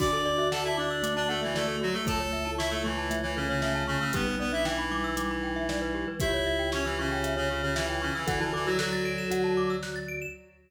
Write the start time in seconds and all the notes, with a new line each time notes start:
0.00 D2 D4 F#4 D5 D6, kick, crash
0.13 A4
0.25 D5
0.38 F#4 E5
0.52 A4 F#5 A5, snare
0.64 E4 E5 A5
0.77 D4 D5 D6
0.91 E6
1.03 A3 D6, closed hi-hat
1.16 D4 D5 A5
1.28 A3 A4 F#5
1.42 E3 E4 E5
1.55 A3 A4 D5, snare
1.68 A4
1.81 F#3 F#4
1.93 A3 A4
2.06 C#2 A3 A4 A5, kick, closed hi-hat
2.20 C#5
2.33 E5
2.45 E4 A5
2.58 E4 E5 C#6, snare
2.70 A3 A4 E6
2.84 E3 A3 E4 C#6
2.98 A5
3.10 A3 E5, closed hi-hat
3.23 E3 E4 C#5
3.36 C#3 C#4 A4
3.49 C#3 C#4 C#5
3.62 C#3 A3 C#4 E5, snare
3.75 A5
3.87 C#3 C#4 C#6
4.00 C#3 C#4 E6
4.13 B1 G3 B3 G4 B4, kick, closed hi-hat
4.27 B4
4.39 B3 B4 D5
4.52 D4 E4 E5
4.65 E3 E4 G5, snare
4.78 B5
4.91 G3 D6
5.04 E6
5.17 G3 D6, closed hi-hat
5.30 B5
5.43 G5
5.56 E5
5.69 G3 D5, snare
5.82 B4
5.95 G4
6.08 B4
6.20 C#2 E4 G4 E5, kick, closed hi-hat
6.34 C#5
6.46 E5
6.59 G5
6.72 C#4 C#5 C#6, snare
6.85 E3 E4 E6
6.99 C#3 C#4 C#6
7.12 G5
7.24 E5, closed hi-hat
7.37 C#3 C#4 C#5
7.50 C#3 C#4 G4
7.62 C#3 C#4 C#5
7.75 E3 E4 E5, snare
7.89 G5
8.02 C#3 C#4 C#6
8.15 E3 E4 E6
8.27 D2 E3 E4 A4 F#5, kick, closed hi-hat
8.40 E3 E4 A5
8.53 E3 E4 A4 D6
8.66 F#3 F#4 E6
8.79 F#3 F#4 A4 F#6, snare
8.92 A6
9.05 D7
9.18 E7
9.30 D2 F#4 F#5, closed hi-hat
9.44 A5
9.57 D6
9.70 E6
9.83 F#6, snare
9.96 A6
10.08 D7
10.22 E7